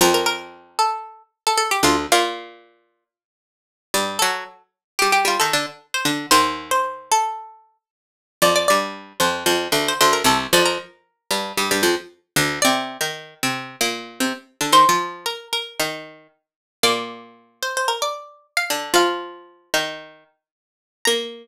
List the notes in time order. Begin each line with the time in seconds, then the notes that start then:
0.01 F2 F3 A#4
0.14 A#4
0.26 A#4
0.79 A4
1.47 A4
1.57 A4
1.71 G4
1.83 D2 D3 F4
2.12 A#2 A#3 F4
3.94 G2 G3
4.19 F#3 F#4 A4
4.99 G3 G4
5.12 G4
5.25 G3 F4 G4
5.40 D#3 D#4 A4
5.53 D3 D4
5.94 C5
6.05 D3 D4
6.31 D#2 D#3 C5
6.71 C5
7.12 A4
8.42 F2 F3 D5
8.56 D5
8.68 G2 G3 D5
9.20 F2 F3 C5
9.46 F2 F3
9.72 D2 D3
9.88 C5
10.01 D2 D3 C5
10.13 A#4
10.24 C2 C3 A4
10.53 F2 F3 D5
10.65 A#4
11.31 G2 G3
11.57 G2 G3
11.71 G2 G3
11.83 F2 F3
12.36 D2 D3
12.62 C3 C4 D5
13.01 D#3 D#4
13.43 C3 C4
13.81 A#2 A#3
14.20 C3 C4
14.61 D3 D4
14.72 D#3 D#4 C5
14.89 F3 F4
15.26 A#4
15.53 A#4
15.79 D#3 D#4
16.83 A#2 A#3 D5
17.63 C5
17.77 C5
17.88 A#4
18.02 D5
18.57 F5
18.70 D3 D4
18.94 F3 F4 F5
19.74 D#3 D#4
21.05 A#3 A#5